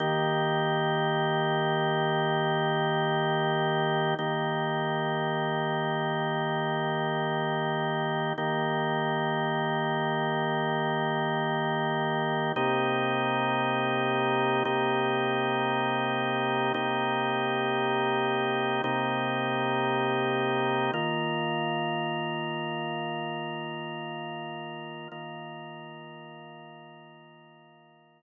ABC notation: X:1
M:3/4
L:1/8
Q:1/4=86
K:Eb
V:1 name="Drawbar Organ"
[E,B,G]6- | [E,B,G]6 | [E,B,G]6- | [E,B,G]6 |
[E,B,G]6- | [E,B,G]6 | [K:Cm] [C,B,EG]6 | [C,B,EG]6 |
[C,B,EG]6 | [C,B,EG]6 | [K:Eb] [E,B,F]6- | [E,B,F]6 |
[E,B,F]6- | [E,B,F]6 |]